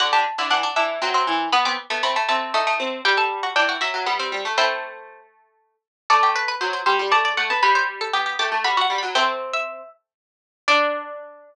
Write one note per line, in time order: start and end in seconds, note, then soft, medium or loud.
0.00 0.12 D3 medium
0.00 0.12 F#4 medium
0.00 0.12 F#5 loud
0.13 0.25 D3 medium
0.13 0.25 G4 medium
0.13 0.47 A5 medium
0.38 0.50 D3 medium
0.38 0.51 E4 medium
0.50 0.63 E3 medium
0.50 0.63 D4 medium
0.50 0.74 F#5 medium
0.63 0.75 D4 medium
0.76 0.99 E3 medium
0.76 0.97 D4 medium
0.76 1.28 E5 medium
1.02 1.26 F#3 medium
1.02 1.14 C4 medium
1.14 1.49 C4 medium
1.27 1.48 E3 medium
1.52 1.65 B3 medium
1.52 1.65 B5 loud
1.65 1.77 B3 medium
1.65 1.78 C4 medium
1.65 1.97 D6 medium
1.90 2.02 A3 medium
1.90 2.03 B3 medium
2.03 2.15 A3 medium
2.03 2.15 C4 medium
2.03 2.25 B5 medium
2.16 2.28 A3 medium
2.28 2.53 A3 medium
2.28 2.53 C4 medium
2.28 2.81 A5 medium
2.54 2.66 A3 medium
2.54 2.76 D#4 medium
2.67 2.99 A3 medium
2.80 3.01 C4 medium
3.05 3.53 G3 medium
3.05 3.17 G4 medium
3.05 3.17 G5 medium
3.17 3.29 A4 medium
3.17 3.55 A5 medium
3.43 3.55 F#4 medium
3.56 3.77 E3 medium
3.56 3.68 D4 medium
3.56 3.81 G5 loud
3.69 3.80 F#4 medium
3.81 3.93 F#3 medium
3.81 4.06 F#4 medium
3.81 4.33 E5 medium
3.94 4.06 F#3 medium
4.06 4.32 G3 medium
4.06 4.19 B3 medium
4.19 4.52 C4 medium
4.32 4.44 G3 medium
4.45 4.57 A3 medium
4.58 5.74 A3 medium
4.58 5.01 C4 medium
4.58 5.01 E4 medium
4.58 5.20 C5 loud
6.10 6.52 A3 medium
6.10 6.22 A4 medium
6.10 6.30 D5 loud
6.23 6.35 G4 medium
6.36 6.60 B4 medium
6.48 6.60 B4 medium
6.61 6.81 F#3 medium
6.61 6.73 C5 medium
6.73 6.85 C5 medium
6.86 6.98 G3 medium
6.86 7.10 C5 medium
6.99 7.11 G3 medium
7.12 7.33 A3 medium
7.12 7.24 D5 medium
7.12 7.34 A5 medium
7.25 7.59 D5 medium
7.37 7.49 A3 medium
7.37 7.49 F#5 medium
7.50 7.62 B3 medium
7.50 7.62 A5 medium
7.63 8.09 G3 medium
7.63 7.75 B4 medium
7.63 8.24 B5 medium
7.75 7.87 C5 medium
8.01 8.13 A4 medium
8.13 8.36 B3 medium
8.13 8.25 G4 medium
8.26 8.38 G4 medium
8.39 8.51 A3 medium
8.39 8.61 G4 medium
8.39 8.64 D6 medium
8.52 8.64 A3 medium
8.64 8.86 G3 medium
8.64 8.76 F#4 medium
8.64 8.81 B5 medium
8.77 9.08 F#4 medium
8.81 8.97 F#5 loud
8.90 9.02 G3 medium
8.98 9.14 B5 medium
9.03 9.15 F#3 medium
9.15 10.12 A3 medium
9.15 10.12 C4 medium
9.15 9.81 C4 medium
9.15 9.27 G5 loud
9.53 9.89 E5 medium
10.68 11.55 D4 loud
10.68 11.55 D5 loud